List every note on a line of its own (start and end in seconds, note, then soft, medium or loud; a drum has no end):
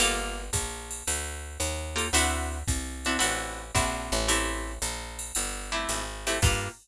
0.00 0.50 G1 medium
0.00 0.42 A#3 loud
0.00 0.42 F4 loud
0.00 0.42 G4 loud
0.00 0.42 A4 loud
0.00 ride loud
0.53 1.03 A#1 medium
0.53 kick medium
0.53 hi-hat pedal loud
0.53 ride loud
0.91 ride medium
1.07 1.58 D2 medium
1.07 ride loud
1.60 2.10 D#2 medium
1.60 hi-hat pedal loud
1.60 ride loud
1.96 2.07 A#3 loud
1.96 2.07 F4 loud
1.96 2.07 G4 loud
1.96 2.07 A4 medium
1.96 ride loud
2.13 2.63 D2 medium
2.13 2.58 C4 loud
2.13 2.58 D4 loud
2.13 2.58 E4 loud
2.13 2.58 F#4 loud
2.13 ride loud
2.68 3.18 C2 medium
2.68 kick medium
2.68 hi-hat pedal medium
2.68 ride loud
3.05 3.17 C4 medium
3.05 3.17 D4 medium
3.05 3.17 E4 loud
3.05 3.17 F#4 medium
3.05 ride medium
3.19 3.71 A1 medium
3.19 3.63 C4 loud
3.19 3.63 D4 medium
3.19 3.63 E4 loud
3.19 3.63 F#4 loud
3.19 ride loud
3.75 4.10 A#1 medium
3.75 4.18 C4 loud
3.75 4.18 D4 medium
3.75 4.18 E4 loud
3.75 4.18 F#4 loud
3.75 kick medium
3.75 hi-hat pedal medium
3.75 ride loud
4.12 4.79 A1 loud
4.12 ride medium
4.28 4.72 A3 loud
4.28 4.72 C4 loud
4.28 4.72 E4 loud
4.28 4.72 G4 loud
4.28 ride loud
4.82 5.32 A#1 medium
4.82 hi-hat pedal loud
4.82 ride loud
5.19 ride medium
5.35 5.86 G1 medium
5.35 ride loud
5.72 6.03 A3 loud
5.72 6.03 C4 loud
5.72 6.03 E4 medium
5.72 6.03 G4 medium
5.89 6.39 G#1 medium
5.89 hi-hat pedal loud
5.89 ride loud
6.27 6.38 A3 loud
6.27 6.38 C4 loud
6.27 6.38 E4 medium
6.27 6.38 G4 medium
6.27 ride loud
6.42 6.69 G2 loud
6.42 6.69 A#3 medium
6.42 6.69 F4 medium
6.42 6.69 G4 loud
6.42 6.69 A4 medium
6.42 kick loud
6.42 crash loud